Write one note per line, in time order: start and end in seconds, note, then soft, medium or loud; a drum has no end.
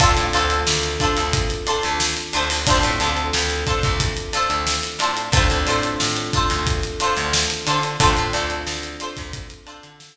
0.00 0.15 D2 loud
0.00 2.62 C4 medium
0.00 0.11 D4 loud
0.00 2.62 D4 medium
0.00 2.62 F4 medium
0.00 0.11 F4 loud
0.00 2.62 A4 medium
0.00 0.11 A4 loud
0.00 0.11 C5 loud
0.00 kick loud
0.00 closed hi-hat loud
0.17 0.32 A2 medium
0.17 closed hi-hat medium
0.33 0.64 D2 medium
0.33 0.57 D4 medium
0.33 0.57 F4 loud
0.33 0.57 A4 loud
0.33 0.57 C5 medium
0.33 closed hi-hat medium
0.50 closed hi-hat medium
0.67 0.97 D2 medium
0.67 snare loud
0.83 closed hi-hat medium
1.00 1.23 D4 loud
1.00 1.23 F4 medium
1.00 1.23 A4 medium
1.00 1.23 C5 medium
1.00 kick medium
1.00 closed hi-hat medium
1.17 1.48 D2 medium
1.17 snare soft
1.17 closed hi-hat medium
1.33 kick loud
1.33 closed hi-hat loud
1.50 closed hi-hat medium
1.67 1.90 D4 medium
1.67 1.90 F4 loud
1.67 1.90 A4 medium
1.67 1.90 C5 medium
1.67 closed hi-hat medium
1.83 2.15 D2 loud
1.83 closed hi-hat medium
2.00 snare loud
2.17 closed hi-hat medium
2.33 2.65 D2 medium
2.33 2.45 D4 medium
2.33 2.45 F4 medium
2.33 2.45 A4 medium
2.33 2.45 C5 loud
2.33 closed hi-hat medium
2.50 open hi-hat medium
2.67 2.83 D2 loud
2.67 5.28 C4 medium
2.67 2.79 D4 loud
2.67 5.28 D4 medium
2.67 5.28 F4 medium
2.67 2.79 F4 loud
2.67 5.28 A4 medium
2.67 2.79 A4 loud
2.67 2.79 C5 loud
2.67 kick loud
2.67 closed hi-hat loud
2.83 2.99 A2 loud
2.83 closed hi-hat medium
3.00 3.31 D2 loud
3.00 3.23 D4 medium
3.00 3.23 F4 medium
3.00 3.23 A4 medium
3.00 3.23 C5 medium
3.00 closed hi-hat medium
3.17 closed hi-hat medium
3.33 3.64 D2 loud
3.33 snare loud
3.50 closed hi-hat medium
3.67 3.90 D4 medium
3.67 3.90 F4 medium
3.67 3.90 A4 medium
3.67 3.90 C5 medium
3.67 kick medium
3.67 closed hi-hat medium
3.83 4.14 D2 medium
3.83 kick loud
3.83 closed hi-hat medium
4.00 kick medium
4.00 closed hi-hat loud
4.17 closed hi-hat medium
4.33 4.56 D4 medium
4.33 4.56 F4 medium
4.33 4.56 A4 medium
4.33 4.56 C5 medium
4.33 closed hi-hat medium
4.50 4.80 D2 medium
4.50 closed hi-hat medium
4.67 snare loud
4.83 closed hi-hat medium
4.99 5.29 A2 medium
4.99 5.12 D4 medium
4.99 5.12 F4 medium
4.99 5.12 A4 medium
4.99 closed hi-hat medium
5.03 5.12 C5 loud
5.17 closed hi-hat medium
5.32 5.47 D2 loud
5.32 7.94 C4 medium
5.32 7.94 D4 medium
5.32 5.45 D4 loud
5.32 7.94 F4 medium
5.32 5.45 F4 loud
5.32 7.94 A4 medium
5.32 5.45 A4 loud
5.32 kick loud
5.32 closed hi-hat loud
5.37 5.45 C5 loud
5.50 5.66 D2 medium
5.50 closed hi-hat medium
5.67 5.97 A2 medium
5.67 5.90 D4 loud
5.67 5.90 F4 medium
5.67 5.90 A4 loud
5.67 5.90 C5 medium
5.67 closed hi-hat medium
5.83 closed hi-hat medium
6.00 6.31 A2 medium
6.00 snare loud
6.17 closed hi-hat medium
6.33 6.57 D4 medium
6.33 6.57 F4 medium
6.33 6.57 A4 medium
6.33 6.57 C5 loud
6.33 kick medium
6.33 closed hi-hat medium
6.50 6.81 D2 medium
6.50 closed hi-hat medium
6.67 kick medium
6.67 closed hi-hat loud
6.83 closed hi-hat medium
7.00 7.23 D4 medium
7.00 7.23 F4 medium
7.00 7.23 A4 medium
7.00 7.23 C5 loud
7.00 closed hi-hat medium
7.17 7.47 D2 loud
7.17 closed hi-hat medium
7.33 snare loud
7.50 snare soft
7.50 closed hi-hat medium
7.67 7.97 D3 loud
7.67 7.78 D4 medium
7.67 7.78 F4 medium
7.67 7.78 A4 medium
7.67 7.78 C5 medium
7.67 closed hi-hat medium
7.83 closed hi-hat medium
8.00 8.16 D2 loud
8.00 10.17 C4 medium
8.00 8.12 D4 loud
8.00 10.17 D4 medium
8.00 10.17 F4 medium
8.00 8.12 F4 loud
8.00 10.17 A4 medium
8.00 8.12 A4 loud
8.00 8.12 C5 loud
8.00 kick loud
8.00 closed hi-hat loud
8.17 8.33 A2 medium
8.17 closed hi-hat medium
8.33 8.64 D2 loud
8.33 8.57 D4 loud
8.33 8.57 F4 medium
8.33 8.57 A4 medium
8.33 8.57 C5 medium
8.33 closed hi-hat medium
8.50 closed hi-hat medium
8.67 8.97 D2 medium
8.67 snare loud
8.83 closed hi-hat medium
9.00 9.23 D4 medium
9.00 9.23 F4 medium
9.00 9.23 A4 loud
9.00 9.23 C5 loud
9.00 closed hi-hat medium
9.17 9.48 D2 medium
9.17 kick medium
9.17 closed hi-hat medium
9.33 kick loud
9.33 closed hi-hat loud
9.50 closed hi-hat medium
9.67 9.90 D4 medium
9.67 9.90 F4 medium
9.67 9.90 A4 medium
9.67 9.90 C5 medium
9.67 closed hi-hat medium
9.83 10.13 D3 loud
9.83 closed hi-hat medium
10.00 snare loud